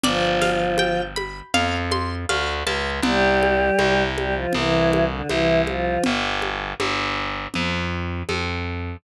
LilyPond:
<<
  \new Staff \with { instrumentName = "Choir Aahs" } { \time 4/4 \key c \major \tempo 4 = 80 <f f'>4. r2 r8 | <g g'>4. <g g'>16 <f f'>16 <e e'>8. <d d'>16 <e e'>8 <f f'>8 | r1 | }
  \new Staff \with { instrumentName = "Orchestral Harp" } { \time 4/4 \key c \major d''8 f''8 g''8 b''8 f''8 c'''8 f''8 a''8 | r1 | r1 | }
  \new Staff \with { instrumentName = "Electric Bass (finger)" } { \clef bass \time 4/4 \key c \major g,,2 f,4 d,8 cis,8 | c,4 c,4 c,4 c,4 | g,,4 g,,4 f,4 f,4 | }
  \new DrumStaff \with { instrumentName = "Drums" } \drummode { \time 4/4 cgl8 <cgho sn>8 cgho8 cgho8 cgl8 cgho8 cgho8 cgho8 | cgl8 cgho8 cgho8 cgho8 cgl8 cgho8 cgho8 cgho8 | cgl8 cgho8 cgho4 cgl4 cgho4 | }
>>